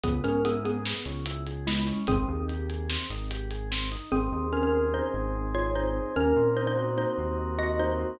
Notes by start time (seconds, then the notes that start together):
0.03 C#2 B3 G#4, kick, closed hi-hat
0.24 G#2 C#4 A#4, closed hi-hat
0.45 B3 E4 G#4, closed hi-hat
0.65 B3 G#4, closed hi-hat
0.85 B3, snare
1.05 C#2 C#4, closed hi-hat
1.26 E4, closed hi-hat
1.47 G#4, closed hi-hat
1.67 G#3 B3 E4, snare
1.87 C#4, closed hi-hat
2.07 G#1 C4 G#4, kick, closed hi-hat
2.28 D#2 D#4
2.48 G4, closed hi-hat
2.69 G#4, closed hi-hat
2.89 C4, snare
3.10 G#1 D#4, closed hi-hat
3.30 G4, closed hi-hat
3.51 G#4, closed hi-hat
3.71 C4, snare
3.91 D#4, closed hi-hat
4.11 G#1 C4 G#4
4.32 D#2 D#4
4.52 C#4 G#4 A#4
4.63 C#4 A#4
4.73 C4
4.93 D#4 C5
5.14 G#1 G#4
5.35 C4
5.54 D#4 F4 C#5
5.75 D#4 G#4 C5
5.95 C4
6.16 D#2 A#3 C#4 A#4
6.36 A#2 C4
6.56 D#4 C5
6.67 D#4 C5
6.77 F#4
6.98 A#3 D#4 C5
7.18 D#2 C4
7.38 D#4
7.59 F#4 D#5
7.79 A#3 D#4 C5
7.99 C4